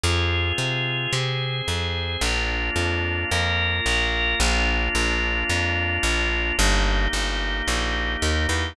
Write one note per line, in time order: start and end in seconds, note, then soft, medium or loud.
0.03 0.53 F2 medium
0.03 1.12 C4 medium
0.03 1.12 F4 medium
0.03 1.12 G#4 medium
0.58 1.07 C3 medium
1.13 1.62 C3 medium
1.13 2.21 C4 medium
1.13 2.21 G#4 medium
1.13 2.21 C5 medium
1.68 2.17 F2 medium
2.21 2.70 A#1 medium
2.21 3.30 A#3 medium
2.21 3.30 D4 medium
2.21 3.30 F4 medium
2.76 3.25 F2 medium
3.31 3.80 F2 medium
3.31 4.39 A#3 medium
3.31 4.39 F4 medium
3.31 4.39 A#4 medium
3.86 4.35 A#1 medium
4.40 4.89 A#1 medium
4.40 6.56 A#3 medium
4.40 6.56 D4 medium
4.40 6.56 F4 medium
4.95 5.44 A#1 medium
5.49 5.99 F2 medium
6.03 6.52 A#1 medium
6.58 7.08 G1 medium
6.58 8.74 A#3 loud
6.58 8.74 D#4 medium
6.58 8.74 G4 medium
7.13 7.62 G1 medium
7.68 8.17 A#1 medium
8.22 8.47 D#2 medium
8.49 8.73 E2 medium